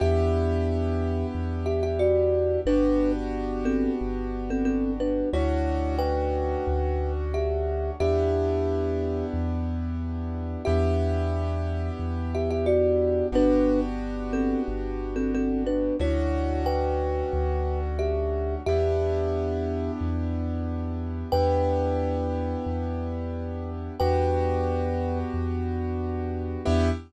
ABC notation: X:1
M:4/4
L:1/16
Q:1/4=90
K:Em
V:1 name="Kalimba"
[Ge]8 z2 [Ge] [Ge] [Fd]4 | [DB]3 z3 [CA]2 z3 [CA] [CA]2 [DB]2 | [E^c]4 [Bg]8 [Ge]4 | [Ge]8 z8 |
[Ge]8 z2 [Ge] [Ge] [Fd]4 | [DB]3 z3 [CA]2 z3 [CA] [CA]2 [DB]2 | [E^c]4 [Bg]8 [Ge]4 | [Ge]8 z8 |
[Bg]16 | [Bg]8 z8 | e4 z12 |]
V:2 name="Acoustic Grand Piano"
[B,DEG]16 | [B,DFG]16 | [A,^CDF]16 | [B,DEG]16 |
[B,DEG]16 | [B,DFG]16 | [A,^CDF]16 | [B,DEG]16 |
[B,DEG]16 | [B,DFG]16 | [B,DEG]4 z12 |]
V:3 name="Synth Bass 2" clef=bass
E,,8 E,,8 | G,,,8 G,,,8 | D,,8 D,,8 | E,,8 E,,8 |
E,,8 E,,8 | G,,,8 G,,,8 | D,,8 D,,8 | E,,8 E,,8 |
E,,8 E,,8 | E,,8 E,,8 | E,,4 z12 |]